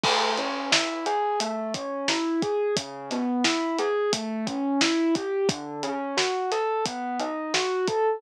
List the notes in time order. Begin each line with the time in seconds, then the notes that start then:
0.04 A3, kick, crash
0.37 C#4, closed hi-hat
0.72 E4, snare
1.06 G#4, closed hi-hat
1.40 A3, closed hi-hat
1.74 C#4, kick, closed hi-hat
2.08 E4, snare
2.42 G#4, kick, closed hi-hat
2.76 C#3, kick, closed hi-hat
3.11 B3, snare, closed hi-hat
3.44 E4, snare
3.79 G#4, closed hi-hat
4.13 A3, kick, closed hi-hat
4.47 C#4, kick, closed hi-hat
4.81 E4, snare
5.15 G4, kick, closed hi-hat
5.49 D3, kick, closed hi-hat
5.83 C#4, closed hi-hat
6.17 F#4, snare
6.52 A4, snare, closed hi-hat
6.86 B3, kick, closed hi-hat
7.20 D#4, closed hi-hat
7.54 F#4, snare
7.88 A4, kick, closed hi-hat